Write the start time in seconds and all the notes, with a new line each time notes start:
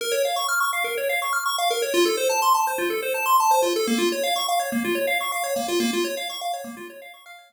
0.01 A#4
0.12 C#5
0.25 F5
0.36 C#6
0.48 F6
0.60 C#6
0.73 F5
0.84 A#4
0.97 C#5
1.09 F5
1.22 C#6
1.33 F6
1.46 C#6
1.58 F5
1.70 A#4
1.82 C#5
1.94 F4
2.05 A4
2.17 C5
2.29 A5
2.42 C6
2.54 A5
2.67 C5
2.78 F4
2.90 A4
3.03 C5
3.14 A5
3.26 C6
3.40 A5
3.51 C5
3.62 F4
3.76 A4
3.87 A#3
3.98 F4
4.12 C#5
4.23 F5
4.36 C#6
4.48 F5
4.59 C#5
4.72 A#3
4.84 F4
4.95 C#5
5.07 F5
5.21 C#6
5.32 F5
5.44 C#5
5.56 A#3
5.68 F4
5.80 A#3
5.93 F4
6.04 C#5
6.17 F5
6.30 C#6
6.41 F5
6.53 C#5
6.64 A#3
6.77 F4
6.90 C#5
7.02 F5
7.14 C#6
7.26 F5
7.38 C#5
7.50 A#3